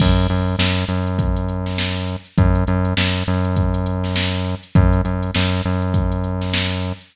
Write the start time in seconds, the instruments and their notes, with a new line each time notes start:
0.00 synth bass 1 F#2, kick, crash
0.18 closed hi-hat
0.30 synth bass 1 F#2, closed hi-hat
0.47 closed hi-hat
0.59 synth bass 1 F#2, snare
0.77 closed hi-hat
0.89 synth bass 1 F#2, closed hi-hat
1.07 closed hi-hat
1.19 kick, closed hi-hat
1.36 closed hi-hat
1.49 closed hi-hat
1.66 snare, closed hi-hat
1.78 snare
1.96 closed hi-hat
2.08 closed hi-hat
2.26 closed hi-hat
2.38 synth bass 1 F#2, kick, closed hi-hat
2.55 closed hi-hat
2.67 synth bass 1 F#2, closed hi-hat
2.85 closed hi-hat
2.97 synth bass 1 F#2, snare
3.15 closed hi-hat
3.27 synth bass 1 F#2, closed hi-hat
3.44 closed hi-hat
3.56 kick, closed hi-hat
3.74 closed hi-hat
3.86 closed hi-hat
4.04 snare, closed hi-hat
4.16 snare
4.34 closed hi-hat
4.46 closed hi-hat
4.63 closed hi-hat
4.75 synth bass 1 F#2, kick, closed hi-hat
4.93 closed hi-hat
5.05 synth bass 1 F#2, closed hi-hat
5.23 closed hi-hat
5.35 synth bass 1 F#2, snare
5.52 closed hi-hat
5.64 synth bass 1 F#2, closed hi-hat
5.82 closed hi-hat
5.94 kick, closed hi-hat
6.12 closed hi-hat
6.24 closed hi-hat
6.41 snare, closed hi-hat
6.54 snare
6.71 closed hi-hat
6.83 closed hi-hat
7.01 closed hi-hat